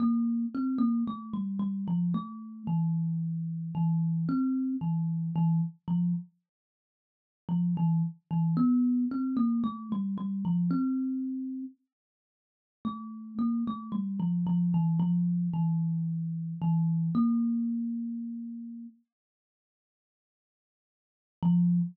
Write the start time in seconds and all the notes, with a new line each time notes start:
0.00 A#3
0.54 C4
0.78 A#3
1.07 A3
1.33 G3
1.59 G3
1.88 F3
2.14 A3
2.67 E3
3.75 E3
4.29 C4
4.81 E3
5.36 E3
5.88 F3
7.49 F3
7.77 E3
8.31 E3
8.57 B3
9.11 C4
9.37 A#3
9.64 A3
9.92 G3
10.18 G3
10.45 F3
10.71 C4
12.85 A3
13.39 A#3
13.67 A3
13.92 G3
14.20 F3
14.47 F3
14.74 E3
15.00 F3
15.54 E3
16.62 E3
17.15 A#3
21.43 F3